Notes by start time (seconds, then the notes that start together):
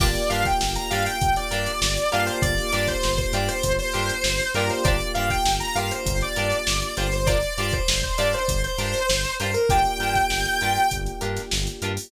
0.00 G1 A#3 D4 F4 G4 A#4 D5, kick, crash
0.15 snare, closed hi-hat
0.29 G2 D4 F4 G4 A#4 F5, closed hi-hat
0.45 G5, kick, closed hi-hat
0.61 G1, snare
0.76 A#5, closed hi-hat
0.90 G2 D4 F4 G4 A#4 F5, closed hi-hat
1.06 G5, closed hi-hat
1.21 G1, kick, closed hi-hat
1.36 D5, closed hi-hat
1.51 G2 D4 F4 G4 A#4, closed hi-hat
1.66 closed hi-hat
1.81 G1, snare
1.97 closed hi-hat
2.12 G2 A#3 D4 F4 G4 A#4 F5, closed hi-hat
2.27 C5, closed hi-hat
2.42 G1 D5, kick, closed hi-hat
2.58 snare, closed hi-hat
2.72 G2 D4 F4 G4 A#4 D5, snare, closed hi-hat
2.88 C5, kick, closed hi-hat
3.03 G1, snare
3.17 C5, kick, closed hi-hat
3.33 G2 D4 F4 G4 A#4 D5, closed hi-hat
3.48 C5, closed hi-hat
3.63 G1, kick, closed hi-hat
3.79 C5, closed hi-hat
3.93 G2 D4 F4 G4 A#4, closed hi-hat
4.09 closed hi-hat
4.24 G1, snare
4.40 closed hi-hat
4.54 G2 A#3 D4 F4 G4 A#4, closed hi-hat
4.69 C5, snare, closed hi-hat
4.84 G1 D4 F4 G4 A#4 D5, kick, closed hi-hat
5.00 closed hi-hat
5.14 G2 D4 F4 G4 A#4 F5, closed hi-hat
5.30 G5, kick, closed hi-hat
5.45 G1, snare
5.60 A#5, closed hi-hat
5.75 G2 D4 F4 G4 A#4 F5, closed hi-hat
5.91 C5, closed hi-hat
6.06 G1, kick, closed hi-hat
6.21 D5, closed hi-hat
6.36 G2 D4 F4 G4 A#4, closed hi-hat
6.52 closed hi-hat
6.67 G1, snare
6.82 closed hi-hat
6.97 G1 D4 F4 G4 A#4 C5, snare, closed hi-hat
7.12 C5, snare, closed hi-hat
7.26 D4 F4 G4 A#4 D5, kick, closed hi-hat
7.42 closed hi-hat
7.57 G2 D4 F4 G4 A#4 D5, closed hi-hat
7.73 C5, kick, closed hi-hat
7.88 G1, snare
8.03 C5, kick, closed hi-hat
8.18 G2 D4 F4 G4 A#4 D5, snare, closed hi-hat
8.33 C5, closed hi-hat
8.48 G1, kick, closed hi-hat
8.64 C5, closed hi-hat
8.78 G2 D4 F4 G4 A#4, closed hi-hat
8.94 closed hi-hat
9.09 G1, snare
9.24 closed hi-hat
9.40 G2 D4 F4 G4 A#4 C5, closed hi-hat
9.54 A#4, closed hi-hat
9.69 G1 A#3 D4 F4 G4 A#4 G5, kick, closed hi-hat
9.85 closed hi-hat
9.99 G2 D4 F4 G4 A#4, closed hi-hat
10.15 kick, snare, closed hi-hat
10.30 G1, snare
10.45 closed hi-hat
10.61 G2 D4 F4 G4 A#4, closed hi-hat
10.76 closed hi-hat
10.91 G1, kick, closed hi-hat
11.06 closed hi-hat
11.21 G2 D4 F4 G4 A#4, closed hi-hat
11.36 snare, closed hi-hat
11.51 G1, snare
11.67 closed hi-hat
11.82 G2 D4 F4 G4 A#4, closed hi-hat
11.97 open hi-hat